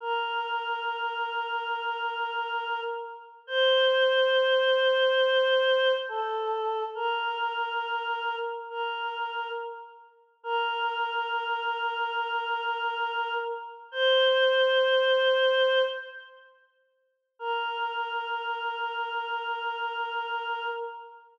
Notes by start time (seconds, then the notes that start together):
0.01 A#4
3.47 C5
6.09 A4
6.95 A#4
8.70 A#4
10.43 A#4
13.92 C5
17.39 A#4